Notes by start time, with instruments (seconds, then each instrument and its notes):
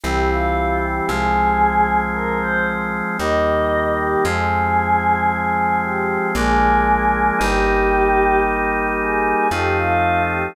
0.04 electric bass (finger) C2, drawbar organ E3 G3 C4, choir aahs G4
0.30 choir aahs F4
0.83 choir aahs G4
1.08 electric bass (finger) C2, drawbar organ F3 G#3 C4, choir aahs G#4
2.13 choir aahs A#4
2.41 choir aahs C5
3.18 electric bass (finger) D#2, drawbar organ D#3 G3 A#3, choir aahs D#5
3.99 choir aahs G4
4.25 electric bass (finger) F2, drawbar organ F3 G#3 C4, choir aahs G#4
5.31 choir aahs G#4
5.83 choir aahs G4
6.35 electric bass (finger) A#1, drawbar organ F3 G#3 A#3 D4, choir aahs G#4
7.39 electric bass (finger) G1, drawbar organ G3 A#3 D#4, choir aahs G4
8.45 choir aahs G4
8.99 choir aahs G#4
9.51 electric bass (finger) F2, drawbar organ F3 A3 C4 D#4, choir aahs G4
9.78 choir aahs F4
10.29 choir aahs G4